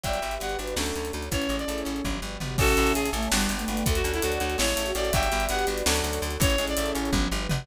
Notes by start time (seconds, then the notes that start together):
0.03 G1 F#3 F#4 G4 B4 D5 E5 G5, kick, closed hi-hat
0.13 closed hi-hat
0.22 G1 G3, closed hi-hat
0.31 E5, closed hi-hat
0.40 G1 B3 G4 F#5, closed hi-hat
0.49 closed hi-hat
0.59 G1 D4 B4, closed hi-hat
0.67 closed hi-hat
0.76 D2 F#3 A3 C#4 D4 F#4 A4 C#5 D5, snare
0.86 closed hi-hat
0.96 D2, closed hi-hat
1.05 closed hi-hat
1.13 D2, closed hi-hat
1.22 closed hi-hat
1.31 A1 E3 C#4 E4 G#4 A4 C#5, kick, closed hi-hat
1.42 closed hi-hat
1.49 A1 G#3, closed hi-hat
1.59 D5, closed hi-hat
1.68 A1 A3, closed hi-hat
1.78 closed hi-hat
1.85 A1 C#4, closed hi-hat
1.96 closed hi-hat
2.04 G1 F#3 F#4 G4 B4 D5, kick, high tom
2.22 G1 G3
2.40 G1 B3, mid tom
2.58 A1 C#4 F#4 A4 C#5 E5 G#5 A5, kick, crash
2.68 closed hi-hat
2.77 A1 E4, closed hi-hat
2.87 closed hi-hat
2.95 A1 G#4, closed hi-hat
3.05 closed hi-hat
3.13 A1 A3 A4, closed hi-hat
3.23 closed hi-hat
3.31 G1 G3 B3 D4 F#4 G4 B4 D5 F#5 G5, snare
3.41 closed hi-hat
3.49 G1, closed hi-hat
3.59 A3, closed hi-hat
3.68 G1 A3, closed hi-hat
3.77 closed hi-hat
3.86 D2 A3 A4 C#5 D5 F#5, kick, closed hi-hat
3.95 F#4, closed hi-hat
4.04 D2 C#4, closed hi-hat
4.14 E4, closed hi-hat
4.22 D2 D4 F#4, closed hi-hat
4.32 closed hi-hat
4.40 D2 F#4, closed hi-hat
4.50 closed hi-hat
4.58 A1 G#3 E4 G#4 A4 C#5 E5, snare
4.68 closed hi-hat
4.76 A1 A3, closed hi-hat
4.85 F#4, closed hi-hat
4.95 A1 C#4 F#4 D5, closed hi-hat
5.05 closed hi-hat
5.12 G1 F#3 F#4 G4 B4 D5 E5 G5, kick, closed hi-hat
5.23 closed hi-hat
5.31 G1 G3, closed hi-hat
5.40 E5, closed hi-hat
5.49 G1 B3 G4 F#5, closed hi-hat
5.59 closed hi-hat
5.67 G1 D4 B4, closed hi-hat
5.78 closed hi-hat
5.86 D2 F#3 A3 C#4 D4 F#4 A4 C#5 D5, snare
5.96 closed hi-hat
6.04 D2, closed hi-hat
6.13 closed hi-hat
6.22 D2, closed hi-hat
6.30 closed hi-hat
6.40 A1 E3 C#4 E4 G#4 A4 C#5, kick, closed hi-hat
6.50 closed hi-hat
6.58 A1 G#3, closed hi-hat
6.67 D5, closed hi-hat
6.77 A1 A3, closed hi-hat
6.86 closed hi-hat
6.95 A1 C#4, closed hi-hat
7.05 closed hi-hat
7.12 G1 F#3 F#4 G4 B4 D5, kick, high tom
7.31 G1 G3
7.49 G1 B3, mid tom